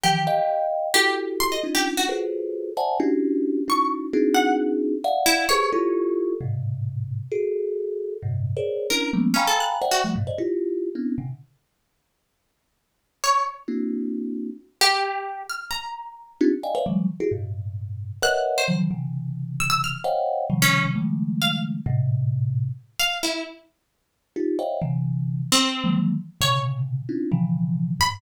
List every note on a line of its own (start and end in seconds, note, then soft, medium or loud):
0.04 0.25 D#3 medium
0.04 0.25 E3 medium
0.04 0.25 F3 medium
0.04 0.65 G4 medium
0.27 0.88 D#5 loud
0.27 0.88 F5 loud
0.27 0.88 G5 loud
0.94 1.57 E4 medium
0.94 1.57 F#4 medium
0.94 1.14 G4 loud
0.94 1.57 G4 medium
0.94 1.57 A4 medium
1.40 1.50 C6 loud
1.52 1.62 D#5 medium
1.63 2.04 C#4 medium
1.63 2.04 D4 medium
1.63 2.04 D#4 medium
1.63 2.04 F4 medium
1.75 1.85 G4 medium
1.97 2.08 F#4 medium
2.09 2.70 F4 medium
2.09 2.70 F#4 medium
2.09 2.70 G#4 medium
2.09 2.70 A4 medium
2.09 2.70 B4 medium
2.09 2.70 C5 medium
2.77 2.97 C5 medium
2.77 2.97 D5 medium
2.77 2.97 E5 medium
2.77 2.97 F#5 medium
2.77 2.97 G#5 medium
2.77 2.97 A5 medium
3.00 3.61 C#4 medium
3.00 3.61 D4 medium
3.00 3.61 E4 medium
3.00 3.61 F#4 medium
3.00 3.61 G4 medium
3.68 4.09 C#4 medium
3.68 4.09 D#4 medium
3.68 4.09 E4 medium
3.68 4.09 F#4 medium
3.68 3.90 C#6 medium
4.13 4.95 C4 medium
4.13 4.95 D4 medium
4.13 4.95 D#4 medium
4.13 4.95 E4 medium
4.13 4.95 F#4 medium
4.13 4.95 G#4 medium
4.34 4.55 F#5 medium
5.04 5.45 D5 loud
5.04 5.45 E5 loud
5.04 5.45 F5 loud
5.04 5.45 F#5 loud
5.26 5.46 E4 loud
5.49 5.70 G4 medium
5.49 5.70 G#4 medium
5.49 5.70 A4 medium
5.49 5.70 B4 medium
5.49 5.70 C5 medium
5.49 6.31 C#5 loud
5.72 6.34 E4 medium
5.72 6.34 F4 medium
5.72 6.34 G4 medium
5.72 6.34 A4 medium
6.41 7.22 G#2 medium
6.41 7.22 A2 medium
6.41 7.22 B2 medium
6.41 7.22 C3 medium
7.32 8.13 F#4 medium
7.32 8.13 G#4 medium
7.32 8.13 A4 medium
8.22 8.53 G2 medium
8.22 8.53 A2 medium
8.22 8.53 A#2 medium
8.22 8.53 C3 medium
8.57 8.87 G#4 medium
8.57 8.87 A#4 medium
8.57 8.87 C5 medium
8.57 8.87 C#5 medium
8.57 8.87 D5 medium
8.90 9.11 C#4 medium
8.90 9.11 D4 medium
8.90 9.11 E4 medium
8.90 9.11 A#4 medium
9.13 9.34 F3 medium
9.13 9.34 G3 medium
9.13 9.34 G#3 medium
9.13 9.34 A#3 medium
9.13 9.34 B3 medium
9.13 9.34 C#4 medium
9.34 9.44 C#4 medium
9.34 9.77 F5 loud
9.34 9.77 G5 loud
9.34 9.77 G#5 loud
9.34 9.77 A#5 loud
9.34 9.77 B5 loud
9.47 9.58 A4 medium
9.60 9.71 F#6 medium
9.82 10.02 C5 medium
9.82 10.02 D5 medium
9.82 10.02 E5 medium
9.82 10.02 F#5 medium
9.82 10.02 G5 medium
9.91 10.02 F#4 medium
10.04 10.14 F3 medium
10.04 10.14 G3 medium
10.04 10.14 A3 medium
10.16 10.26 G2 medium
10.16 10.26 A2 medium
10.16 10.26 B2 medium
10.27 10.37 C5 medium
10.27 10.37 D5 medium
10.27 10.37 D#5 medium
10.38 10.89 E4 medium
10.38 10.89 F4 medium
10.38 10.89 G4 medium
10.95 11.16 B3 medium
10.95 11.16 C4 medium
10.95 11.16 C#4 medium
10.95 11.16 D4 medium
10.95 11.16 E4 medium
11.18 11.28 A#2 medium
11.18 11.28 C3 medium
11.18 11.28 C#3 medium
11.18 11.28 D3 medium
13.24 13.44 C#5 medium
13.68 14.50 A#3 medium
13.68 14.50 C4 medium
13.68 14.50 D4 medium
13.68 14.50 E4 medium
13.68 14.50 F#4 medium
14.81 15.43 G4 loud
15.50 15.70 F6 medium
15.71 16.32 A#5 medium
16.41 16.51 C4 loud
16.41 16.51 D4 loud
16.41 16.51 D#4 loud
16.41 16.51 F4 loud
16.41 16.51 G4 loud
16.63 16.74 D5 medium
16.63 16.74 D#5 medium
16.63 16.74 F5 medium
16.63 16.74 G5 medium
16.63 16.74 G#5 medium
16.75 16.85 B4 medium
16.75 16.85 C5 medium
16.75 16.85 C#5 medium
16.75 16.85 D5 medium
16.75 16.85 E5 medium
16.75 16.85 F5 medium
16.86 17.07 D3 medium
16.86 17.07 E3 medium
16.86 17.07 F#3 medium
16.86 17.07 G3 medium
16.86 17.07 G#3 medium
17.20 17.30 E4 medium
17.20 17.30 F#4 medium
17.20 17.30 G4 medium
17.20 17.30 G#4 medium
17.32 18.13 G2 medium
17.32 18.13 A2 medium
17.32 18.13 B2 medium
18.22 18.63 A#4 medium
18.22 18.63 B4 medium
18.22 18.63 C#5 medium
18.22 18.63 D#5 medium
18.22 18.63 E5 medium
18.22 18.63 F#5 medium
18.22 18.33 F#6 loud
18.58 18.68 C5 medium
18.68 18.88 C#3 medium
18.68 18.88 D#3 medium
18.68 18.88 E3 medium
18.68 18.88 F3 medium
18.68 18.88 F#3 medium
18.91 19.93 C3 medium
18.91 19.93 C#3 medium
18.91 19.93 D3 medium
18.91 19.93 E3 medium
19.60 19.69 E6 loud
19.70 19.80 E6 loud
19.84 20.04 F6 medium
20.04 20.45 C5 medium
20.04 20.45 C#5 medium
20.04 20.45 D#5 medium
20.04 20.45 F5 medium
20.04 20.45 F#5 medium
20.04 20.45 G5 medium
20.50 20.91 C3 medium
20.50 20.91 C#3 medium
20.50 20.91 D#3 medium
20.50 20.91 F3 medium
20.50 20.91 G3 medium
20.62 20.82 C#4 loud
20.95 21.77 C#3 medium
20.95 21.77 D#3 medium
20.95 21.77 F3 medium
20.95 21.77 G3 medium
20.95 21.77 G#3 medium
20.95 21.77 A3 medium
21.42 21.52 F5 medium
21.86 22.68 A2 loud
21.86 22.68 A#2 loud
21.86 22.68 C3 loud
22.99 23.20 F5 medium
23.23 23.43 E4 medium
24.36 24.57 D#4 medium
24.36 24.57 F4 medium
24.36 24.57 G4 medium
24.59 24.79 C5 medium
24.59 24.79 C#5 medium
24.59 24.79 D#5 medium
24.59 24.79 E5 medium
24.59 24.79 F5 medium
24.59 24.79 G5 medium
24.82 25.43 C3 medium
24.82 25.43 D3 medium
24.82 25.43 E3 medium
25.52 25.93 C4 loud
25.84 26.14 D#3 medium
25.84 26.14 E3 medium
25.84 26.14 F3 medium
25.84 26.14 F#3 medium
25.84 26.14 G#3 medium
25.84 26.14 A#3 medium
26.41 27.02 A#2 medium
26.41 27.02 B2 medium
26.41 27.02 C3 medium
26.41 27.02 C#3 medium
26.41 27.02 D3 medium
26.41 26.62 C#5 medium
27.09 27.29 C4 medium
27.09 27.29 C#4 medium
27.09 27.29 D4 medium
27.09 27.29 D#4 medium
27.09 27.29 E4 medium
27.09 27.29 F4 medium
27.32 27.93 B2 medium
27.32 27.93 C#3 medium
27.32 27.93 D3 medium
27.32 27.93 E3 medium
27.32 27.93 F3 medium
28.00 28.20 F#2 medium
28.00 28.20 G2 medium
28.00 28.20 G#2 medium
28.00 28.11 B5 loud